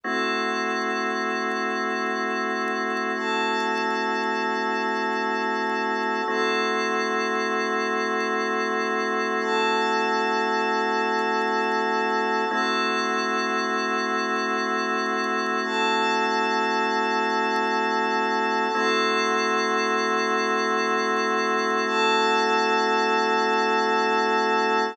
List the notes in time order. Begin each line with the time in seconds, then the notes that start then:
0.03 A3 C4 E4 F#4 A4 F#5 C6 E6
3.15 A4 F#5 A5 E6
6.28 A3 C4 E4 F#4 A4 F#5 C6 E6
9.39 A4 F#5 A5 E6
12.50 A3 C4 E4 F#4 A4 F#5 C6 E6
15.63 A4 F#5 A5 E6
18.74 A3 C4 E4 F#4 A4 F#5 C6 E6
21.86 A4 F#5 A5 E6